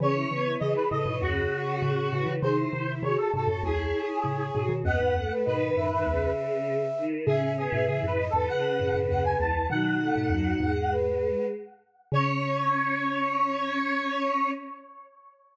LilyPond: <<
  \new Staff \with { instrumentName = "Lead 1 (square)" } { \time 4/4 \key cis \minor \tempo 4 = 99 cis''4 dis''16 b'16 dis''8 fis'2 | bis'4 cis''16 a'16 a'8 gis'2 | fis''4 b'4. r4. | gis'8 gis'8 \tuplet 3/2 { gis'8 b'8 a'8 } fis''4 fis''16 gis''16 a''8 |
fis''2~ fis''8 r4. | cis''1 | }
  \new Staff \with { instrumentName = "Flute" } { \time 4/4 \key cis \minor gis'16 e'16 r16 e'16 gis'8 a'16 cis''2~ cis''16 | gis'16 e'16 r16 e'16 gis'8 a'16 cis''2~ cis''16 | dis''16 b'16 r16 b'16 dis''8 e''16 e''2~ e''16 | e''16 e''16 r16 e''16 e''8 dis''16 b'2~ b'16 |
dis'2 b'4 r4 | cis''1 | }
  \new Staff \with { instrumentName = "Choir Aahs" } { \time 4/4 \key cis \minor cis'8 b8 e8. e16 cis4. e8 | dis'8 e'8 fis'8. fis'16 e'4. fis'8 | b8 a8 dis8. dis16 cis4. dis8 | cis'8 b8 e8. e16 cis4. e8 |
fis8 a8 fis8 gis4. r4 | cis'1 | }
  \new Staff \with { instrumentName = "Xylophone" } { \clef bass \time 4/4 \key cis \minor <cis e>8 <cis e>8 <cis e>16 r16 <a, cis>16 <gis, b,>16 <dis, fis,>8 r8 <a, cis>8 <a, cis>16 <cis e>16 | <bis, dis>8 <bis, dis>8 <bis, dis>16 r16 <gis, bis,>16 <fis, a,>16 <cis, e,>8 r8 <a, cis>8 <gis, b,>16 <b, dis>16 | <dis, fis,>16 <e, gis,>16 <dis, fis,>16 r16 <gis, b,>8 <fis, a,>8 <cis, e,>8 r4. | <a, cis>8. <gis, b,>16 <a, cis>16 <fis, a,>8 <e, gis,>16 r8 <fis, a,>16 <fis, a,>16 <dis, fis,>8 <cis, e,>8 |
<b, dis>8. <gis, b,>16 <dis, fis,>8 <e, gis,>4. r4 | cis1 | }
>>